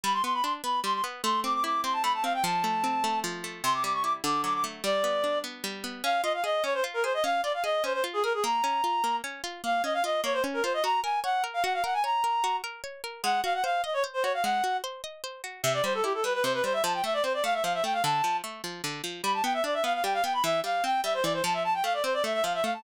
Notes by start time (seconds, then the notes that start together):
0.04 G3 B5
0.13 C6
0.24 B3 C6
0.34 B5
0.43 D4 C6
0.64 B3 B5
0.84 G3 C6
0.94 C6
1.04 B3
1.23 A3 C6
1.44 C4 D6
1.54 D6
1.64 E4 D6
1.84 C4 C6
1.93 A5
2.03 A3 B5
2.14 A5
2.24 C4 F5
2.34 G5
2.44 F3 A5
2.64 A3
2.84 C4
3.04 A3
3.24 F3
3.44 A3
3.64 C3 C6
3.74 D6
3.84 G3 D6
3.93 C#6
4.04 E4 D6
4.24 D3 D6
4.44 F#3 D6
4.54 D6
4.64 A3
4.84 G3 D5
5.04 B3
5.24 D4
5.44 B3
5.64 G3
5.84 B3
6.04 C#4 F5
6.23 F4 D#5
6.34 F5
6.44 G#4 D#5
6.64 C#4 C#5
6.74 C5
6.84 F4
6.94 A#4
7.04 G#4 C5
7.14 D#5
7.24 C#4 F5
7.43 F4 D5
7.54 F5
7.64 G#4 D#5
7.84 C#4 C5
7.94 C5
8.04 F4
8.13 G#4
8.23 G#4 A#4
8.34 G#4
8.44 A#3 A#5
8.64 C#4
8.84 F4
9.04 A#3
9.24 C#4
9.44 F4
9.64 A#3 F5
9.84 C#4 D#5
9.94 F5
10.04 F4 D#5
10.24 A#3 C#5
10.33 C5
10.44 C#4
10.54 A#4
10.64 F4 C5
10.74 D#5
10.84 F#4 A#5
11.03 A#4 G#5
11.24 C#5 F#5
11.44 A#4
11.54 F5
11.64 F#4 F#5
11.74 F5
11.84 A#4 F#5
11.94 G#5
12.04 C#5 A#5
12.24 A#4
12.44 F#4
12.64 A#4
12.84 C#5
13.04 A#4
13.23 G#3 F#5
13.44 F#4 F5
13.54 F#5
13.64 C5 F5
13.84 D#5
13.94 C#5
14.04 C5
14.14 C5
14.23 F#4 C#5
14.34 F5
14.43 G#3 F#5
14.64 F#4
14.84 C5
15.04 D#5
15.24 C5
15.44 F#4
15.63 C3 E5
15.74 D5
15.84 G3 C5
15.94 A4
16.03 E4 G4
16.14 A4
16.24 G3 B4
16.34 B4
16.43 C3 C5
16.54 B4
16.64 G3 C5
16.73 E5
16.83 F3 A5
16.94 G5
17.04 A3 E5
17.14 D5
17.23 C4 C5
17.34 D5
17.44 A3 F5
17.54 E5
17.64 F3 F5
17.74 E5
17.84 A3 G5
17.93 F5
18.04 D3 A5
18.24 F3
18.44 A3
18.64 F3
18.84 D3
19.04 F3
19.23 G3 B5
19.34 A5
19.44 B3 G5
19.54 E5
19.64 D4 D5
19.74 E5
19.84 B3 F5
19.94 F5
20.04 G3 G5
20.14 F5
20.24 B3 G5
20.33 B5
20.44 E3 E5
20.64 G3 F5
20.84 C4 G5
21.04 G3 E5
21.14 C5
21.23 E3 D5
21.33 C5
21.44 F3 A5
21.54 E5
21.64 A5
21.74 G5
21.84 A3 F5
21.94 D5
22.04 C4 C5
22.14 D5
22.24 A3 E5
22.34 E5
22.43 F3 F5
22.54 E5
22.64 A3 F5
22.74 A5